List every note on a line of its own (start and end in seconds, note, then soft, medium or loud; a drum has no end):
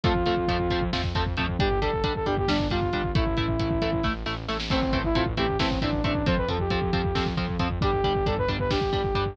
0.04 0.23 F2 medium
0.04 0.13 F3 medium
0.04 0.13 A3 medium
0.04 0.13 C4 medium
0.04 0.83 F4 loud
0.04 kick loud
0.04 closed hi-hat medium
0.15 kick medium
0.26 0.45 F2 medium
0.26 0.35 F3 medium
0.26 0.35 A3 medium
0.26 0.35 C4 medium
0.26 kick medium
0.26 closed hi-hat medium
0.37 kick medium
0.48 0.67 F2 medium
0.48 0.57 F3 medium
0.48 0.57 A3 medium
0.48 0.57 C4 medium
0.48 kick medium
0.48 closed hi-hat medium
0.60 kick medium
0.70 0.90 F2 medium
0.70 0.80 F3 medium
0.70 0.80 A3 medium
0.70 0.80 C4 medium
0.70 kick medium
0.70 closed hi-hat medium
0.81 kick medium
0.93 1.12 F2 medium
0.93 1.02 F3 medium
0.93 1.02 A3 medium
0.93 1.02 C4 medium
0.93 kick medium
0.93 snare medium
1.04 kick medium
1.15 1.34 F2 medium
1.15 1.24 F3 medium
1.15 1.24 A3 medium
1.15 1.24 C4 medium
1.15 kick medium
1.15 closed hi-hat medium
1.26 kick medium
1.37 1.56 F2 medium
1.37 1.46 F3 medium
1.37 1.46 A3 medium
1.37 1.46 C4 medium
1.37 kick medium
1.37 closed hi-hat medium
1.49 kick medium
1.59 1.79 G1 medium
1.59 1.69 G3 medium
1.59 1.69 D4 medium
1.59 1.80 G4 loud
1.59 kick loud
1.59 closed hi-hat medium
1.71 kick medium
1.81 2.01 G1 medium
1.81 1.91 G3 medium
1.81 1.91 D4 medium
1.81 2.14 A4 medium
1.81 kick medium
1.81 closed hi-hat medium
1.93 kick medium
2.04 2.23 G1 medium
2.04 2.13 G3 medium
2.04 2.13 D4 medium
2.04 kick medium
2.04 closed hi-hat loud
2.16 2.26 A4 medium
2.16 kick medium
2.26 2.45 G1 medium
2.26 2.35 G3 medium
2.26 2.35 D4 medium
2.26 2.36 G4 medium
2.26 kick medium
2.26 closed hi-hat medium
2.37 2.49 G4 medium
2.37 kick medium
2.48 2.67 G1 medium
2.48 2.57 G3 medium
2.48 2.57 D4 medium
2.48 2.67 D4 medium
2.48 kick medium
2.48 snare loud
2.59 kick medium
2.70 2.90 G1 medium
2.70 2.80 G3 medium
2.70 2.80 D4 medium
2.70 3.11 F4 medium
2.70 kick medium
2.70 closed hi-hat medium
2.82 kick medium
2.93 3.12 G1 medium
2.93 3.02 G3 medium
2.93 3.02 D4 medium
2.93 kick medium
2.93 closed hi-hat medium
3.04 kick medium
3.15 3.34 A1 medium
3.15 3.24 A3 medium
3.15 3.24 E4 medium
3.15 4.06 E4 loud
3.15 kick loud
3.15 closed hi-hat medium
3.27 kick medium
3.37 3.56 A1 medium
3.37 3.46 A3 medium
3.37 3.46 E4 medium
3.37 kick medium
3.37 closed hi-hat medium
3.48 kick medium
3.59 3.78 A1 medium
3.59 3.69 A3 soft
3.59 3.69 E4 medium
3.59 kick medium
3.59 closed hi-hat loud
3.71 kick medium
3.82 4.01 A1 medium
3.82 3.91 A3 medium
3.82 3.91 E4 medium
3.82 kick medium
3.82 closed hi-hat medium
3.93 kick medium
4.03 4.23 A1 medium
4.03 4.13 A3 medium
4.03 4.13 E4 medium
4.03 kick medium
4.03 snare medium
4.26 4.45 A1 medium
4.26 4.35 A3 medium
4.26 4.35 E4 medium
4.26 snare medium
4.48 4.67 A1 medium
4.48 4.57 A3 medium
4.48 4.57 E4 medium
4.48 snare medium
4.60 snare loud
4.70 4.90 A1 medium
4.70 4.80 A3 medium
4.70 4.98 C4 loud
4.70 4.80 C4 medium
4.70 4.80 E4 medium
4.70 kick medium
4.70 crash medium
4.82 kick medium
4.93 5.12 A1 medium
4.93 5.02 A3 medium
4.93 5.02 C4 medium
4.93 5.02 E4 medium
4.93 kick medium
4.93 closed hi-hat medium
5.04 5.15 E4 loud
5.04 kick medium
5.15 5.34 A1 medium
5.15 5.24 A3 medium
5.15 5.24 C4 medium
5.15 5.24 E4 medium
5.15 5.26 F4 medium
5.15 kick medium
5.15 closed hi-hat medium
5.26 kick medium
5.37 5.56 A1 medium
5.37 5.46 A3 medium
5.37 5.46 C4 medium
5.37 5.46 E4 medium
5.37 5.57 G4 medium
5.37 kick medium
5.37 closed hi-hat medium
5.49 kick medium
5.59 5.78 A1 medium
5.59 5.69 A3 medium
5.59 5.69 C4 medium
5.59 5.79 C4 medium
5.59 5.69 E4 medium
5.59 kick medium
5.59 snare loud
5.71 kick medium
5.81 6.01 A1 medium
5.81 5.91 A3 medium
5.81 5.91 C4 medium
5.81 6.03 D4 medium
5.81 5.91 E4 medium
5.81 kick medium
5.81 closed hi-hat medium
5.93 kick medium
6.04 6.23 A1 medium
6.04 6.13 A3 medium
6.04 6.13 C4 medium
6.04 6.26 D4 medium
6.04 6.13 E4 medium
6.04 kick medium
6.04 closed hi-hat medium
6.15 kick medium
6.26 6.45 F2 medium
6.26 6.35 F3 medium
6.26 6.35 C4 medium
6.26 6.37 C5 loud
6.26 kick loud
6.26 closed hi-hat medium
6.37 6.48 B4 medium
6.37 kick medium
6.48 6.67 F2 medium
6.48 6.57 F3 medium
6.48 6.57 C4 medium
6.48 6.59 A4 medium
6.48 kick medium
6.48 closed hi-hat medium
6.60 7.26 G4 medium
6.60 kick medium
6.70 6.90 F2 medium
6.70 6.80 F3 medium
6.70 6.80 C4 medium
6.70 kick medium
6.70 closed hi-hat medium
6.82 kick medium
6.93 7.12 F2 medium
6.93 7.02 F3 medium
6.93 7.02 C4 medium
6.93 kick medium
6.93 closed hi-hat medium
7.04 kick medium
7.15 7.34 F2 medium
7.15 7.24 F3 medium
7.15 7.24 C4 medium
7.15 kick medium
7.15 snare medium
7.26 kick medium
7.37 7.56 F2 medium
7.37 7.46 F3 medium
7.37 7.46 C4 medium
7.37 kick medium
7.37 closed hi-hat medium
7.49 kick medium
7.59 7.78 F2 medium
7.59 7.68 F3 medium
7.59 7.68 C4 medium
7.59 kick medium
7.59 closed hi-hat medium
7.71 kick medium
7.81 8.01 G1 medium
7.81 7.91 G3 medium
7.81 7.91 D4 medium
7.81 8.26 G4 loud
7.81 kick loud
7.81 closed hi-hat medium
7.93 kick medium
8.04 8.23 G1 medium
8.04 8.13 G3 medium
8.04 8.13 D4 medium
8.04 kick medium
8.04 closed hi-hat medium
8.15 kick medium
8.26 8.45 G1 medium
8.26 8.35 G3 medium
8.26 8.35 D4 medium
8.26 8.37 A4 medium
8.26 kick medium
8.26 closed hi-hat medium
8.38 8.49 B4 medium
8.38 kick medium
8.48 8.67 G1 medium
8.48 8.57 G3 medium
8.48 8.57 D4 medium
8.48 kick medium
8.48 closed hi-hat medium
8.60 8.70 B4 medium
8.60 kick medium
8.70 8.90 G1 medium
8.70 8.80 G3 medium
8.70 8.80 D4 medium
8.70 9.33 G4 medium
8.70 kick medium
8.70 snare loud
8.81 kick medium
8.93 9.12 G1 medium
8.93 9.02 G3 medium
8.93 9.02 D4 medium
8.93 kick medium
8.93 closed hi-hat medium
9.04 kick medium
9.14 9.34 G1 medium
9.14 9.24 G3 medium
9.14 9.24 D4 medium
9.14 kick medium
9.14 closed hi-hat medium
9.26 kick medium